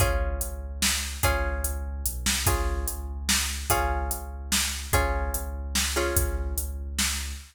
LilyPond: <<
  \new Staff \with { instrumentName = "Acoustic Guitar (steel)" } { \time 3/4 \key des \major \tempo 4 = 146 <des' f' aes'>2. | <des' f' aes'>2. | <des' f' aes'>2. | <des' f' aes'>2. |
<des' f' aes'>2~ <des' f' aes'>8 <des' f' aes'>8~ | <des' f' aes'>2. | }
  \new Staff \with { instrumentName = "Synth Bass 2" } { \clef bass \time 3/4 \key des \major des,4 des,2 | des,4 des,4 b,,8 c,8 | des,4 des,2 | des,4 des,2 |
des,4 des,2 | des,4 des,2 | }
  \new DrumStaff \with { instrumentName = "Drums" } \drummode { \time 3/4 <hh bd>4 hh4 sn4 | <hh bd>4 hh4 hh8 sn8 | <hh bd>4 hh4 sn4 | <hh bd>4 hh4 sn4 |
<hh bd>4 hh4 sn4 | <hh bd>4 hh4 sn4 | }
>>